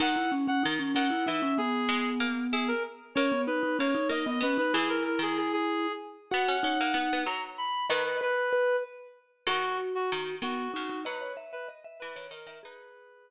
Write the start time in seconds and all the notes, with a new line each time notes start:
0.00 D#3 D#4 F#5
0.16 E4
0.32 C#4
0.48 C#4 F#5
0.63 D#3 D#4
0.79 C#4
0.95 D#3 C#4 F#5
1.10 E4
1.26 E3 D#4 E5
1.42 C#4
1.58 B3 G#4
1.89 G#3
2.20 A#3
2.52 E4 G#4
2.68 A#4
3.15 A#3 C#4 C#5
3.32 B3
3.47 D#4 B4
3.63 D#4
3.79 A#3 C#4 C#5
3.95 D#4
4.09 A#3 D#4 D#5
4.26 B3 D#5
4.40 B3 C#4 B4
4.58 D#4 B4
4.73 E3 E4 G#4
4.89 A#4
5.04 A#4
5.19 D#3 G#4
5.37 G#4
5.53 G#4
6.31 B3 F#4 F#5
6.48 C#4
6.63 C#4 D#4
6.80 A#3
6.94 B3 D#4
7.13 B3
7.26 F#3 A#5
7.58 B5
7.89 D#3 B4 D#5
8.06 B4
8.21 B4
8.53 B4
9.47 D#3 F#4
9.95 F#4
10.12 D#3
10.42 D#3 B3 F#4
10.73 C#3 D#4 F#4
10.89 D#4
11.05 F#3 B4 D#5
11.21 C#5
11.37 E5
11.52 B4 E5
11.68 D#5
11.84 E5
11.99 E3 B4 E5
12.16 D#3 C#5
12.31 D#3 A#4 D#5
12.46 D#3 E5
12.63 D#4 G#4 B4